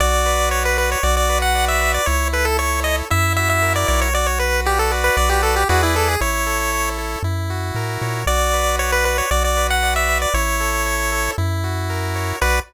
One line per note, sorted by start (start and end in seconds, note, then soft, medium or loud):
0.00 0.96 B1 loud
0.00 0.98 F#4 loud
0.00 0.49 D5 loud
0.26 0.77 B4 medium
0.51 0.63 C#5 medium
0.51 1.01 D5 medium
0.65 0.77 B4 loud
0.78 1.02 B4 medium
0.78 0.90 B4 medium
0.92 1.04 C#5 medium
1.03 1.99 B1 loud
1.03 2.02 F#4 loud
1.03 1.15 D5 medium
1.17 1.39 D5 medium
1.29 1.80 B4 medium
1.42 1.65 F#5 medium
1.55 2.04 D5 medium
1.68 1.92 E5 medium
1.81 2.06 B4 medium
1.94 2.07 D5 medium
2.06 3.03 C#2 loud
2.06 3.05 E4 loud
2.06 2.28 C#5 loud
2.33 2.84 A4 medium
2.33 2.46 B4 medium
2.45 2.57 A4 medium
2.59 3.08 C#5 medium
2.59 2.80 C#5 loud
2.84 3.09 A4 medium
2.84 2.96 D#5 medium
3.10 3.85 F#2 loud
3.10 4.09 E4 loud
3.10 3.33 E5 medium
3.36 4.10 F#4 medium
3.36 3.49 E5 medium
3.49 3.73 E5 medium
3.62 4.11 A#4 medium
3.76 3.87 D5 medium
3.88 5.10 B1 loud
3.88 4.12 C#5 medium
3.88 4.00 D5 medium
4.02 4.14 C#5 medium
4.14 4.91 F#4 medium
4.14 4.27 D5 loud
4.27 4.39 C#5 medium
4.39 4.61 B4 medium
4.39 4.91 B4 medium
4.66 4.79 G4 medium
4.66 4.91 D5 medium
4.79 4.91 A4 medium
4.91 5.64 F#4 loud
4.91 5.64 B4 loud
4.91 5.64 D5 loud
5.04 5.16 B4 medium
5.17 5.65 B1 loud
5.17 5.29 D5 medium
5.30 5.42 G4 loud
5.43 5.55 A4 medium
5.56 5.68 G4 medium
5.69 6.17 E2 loud
5.69 6.16 E4 medium
5.69 5.82 F#4 medium
5.69 6.16 G#4 loud
5.69 6.16 B4 loud
5.69 6.16 D5 loud
5.83 5.95 E4 medium
5.96 6.08 A4 medium
6.08 6.21 G#4 medium
6.21 7.16 A1 loud
6.21 7.19 E4 loud
6.21 6.89 C#5 loud
6.47 6.98 A4 medium
6.72 7.22 C#5 medium
6.98 7.23 A4 medium
7.23 7.72 F#2 loud
7.23 8.22 E4 medium
7.50 8.24 F#4 medium
7.75 7.98 A2 medium
7.75 8.25 A#4 medium
8.02 8.25 A#2 medium
8.02 8.26 C#5 medium
8.26 9.22 B1 loud
8.26 9.26 F#4 loud
8.26 8.76 D5 medium
8.53 9.05 B4 medium
8.79 8.91 C#5 medium
8.79 9.28 D5 medium
8.92 9.05 B4 medium
9.05 9.17 B4 medium
9.05 9.30 B4 medium
9.18 9.30 C#5 medium
9.31 10.26 B1 loud
9.31 10.29 F#4 medium
9.31 9.43 D5 loud
9.44 9.67 D5 medium
9.57 10.08 B4 medium
9.70 9.94 F#5 medium
9.83 10.32 D5 medium
9.96 10.18 E5 medium
10.09 10.33 B4 medium
10.22 10.34 D5 medium
10.34 11.29 A1 loud
10.34 11.33 E4 loud
10.34 11.31 C#5 loud
10.60 11.12 A4 medium
10.86 11.35 C#5 medium
11.12 11.37 A4 medium
11.38 12.33 F#2 loud
11.38 12.36 E4 loud
11.64 12.37 F#4 medium
11.90 12.39 A#4 medium
12.16 12.40 C#5 medium
12.41 12.60 B1 loud
12.41 12.59 F#4 loud
12.41 12.59 B4 loud
12.41 12.60 B4 loud
12.41 12.59 D5 loud